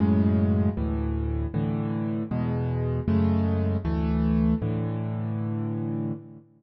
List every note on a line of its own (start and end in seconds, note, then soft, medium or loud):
0.00 0.69 F#2 loud
0.00 0.69 A2 loud
0.00 0.69 C#3 loud
0.00 0.69 G#3 loud
0.77 1.46 D2 loud
0.77 1.46 A2 loud
0.77 1.46 E3 loud
1.54 2.23 A2 loud
1.54 2.23 D3 loud
1.54 2.23 E3 loud
2.31 3.00 E2 loud
2.31 3.00 B2 loud
2.31 3.00 G#3 loud
3.08 3.77 F#2 loud
3.08 3.77 C#3 loud
3.08 3.77 G#3 loud
3.08 3.77 A3 loud
3.85 4.54 D2 loud
3.85 4.54 E3 loud
3.85 4.54 A3 loud
4.62 6.12 A2 loud
4.62 6.12 D3 loud
4.62 6.12 E3 loud